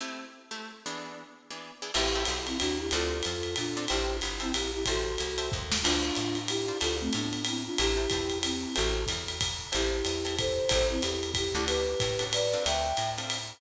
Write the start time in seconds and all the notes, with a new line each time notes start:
0.00 A3 C4 E4 G4
0.51 A3 C4 E4 G4
0.86 E3 B3 D4 G#4
1.50 E3 B3 D4 G#4
1.82 E3 B3 D4 G#4
1.94 A1 C4 E4 G4 A4, crash, ride
2.15 C4 E4 G4 A4
2.25 B1, hi-hat pedal, ride
2.46 C4 E4, ride
2.59 D#2 D4 F#4, ride
2.79 E4 G4
2.91 D2 C4 D4 F4 A4, ride
3.23 F2, hi-hat pedal, ride
3.43 ride
3.56 A#2 D4 F4, ride
3.77 C4 D4 F4 A4
3.88 A1 E4 G4 C5 E5 G5 A5, ride
4.21 G1, hi-hat pedal, ride
4.40 C4 E4 C5 E5 G5 A5, ride
4.54 A#1 E4 G4, ride
4.73 E4 G4
4.85 A1 F#4 A4 C5 E5 G5 A5, kick, ride
5.18 C2, hi-hat pedal, ride
5.38 C5 E5 G5 A5, ride
5.52 D#2, kick
5.72 snare
5.83 D2 D4 F4 C5 D5 F5 A5, crash, ride
6.15 A2, hi-hat pedal, ride
6.35 ride
6.48 E4 G4, ride
6.68 C5 D5 F5 A5
6.81 D2 F4 A4 C5 D5 F5 A5, ride
7.00 A3 C4
7.13 A2 B3 D4, hi-hat pedal, ride
7.33 ride
7.45 C4 E4, ride
7.66 D4 F4
7.78 A1 E4 G4 C5 E5 G5 A5, ride
7.97 C5 E5 G5 A5
8.10 E2 C5 E5 G5 A5, kick, hi-hat pedal, ride
8.30 ride
8.43 C4 E4, ride
8.75 A1 F#4 A4 C5 E5 G5 A5, ride
9.06 E2, kick, hi-hat pedal, ride
9.28 ride
9.41 kick, ride
9.72 A1 C4 E4 G4 A4, ride
10.05 E2, hi-hat pedal, ride
10.25 C4 E4 G4 A4, ride
10.39 A4 C5, kick, ride
10.69 A1 C4 E4 G4 A4 C5, kick, ride
10.90 C4 E4
11.02 E2 E4 G4, hi-hat pedal, ride
11.23 ride
11.34 E4 G4, kick, ride
11.54 D2 C#4 D4 E4 F#4 G4 A4
11.66 G4 B4, ride
12.00 A2, kick, hi-hat pedal, ride
12.19 C#4 D4 F#4 A4, ride
12.33 B4 D5, ride
12.53 C4 D4 F4 A4
12.65 D2 E5 G5, ride
12.97 A2, hi-hat pedal, ride
13.18 C4 D4 F4 A4, ride
13.30 ride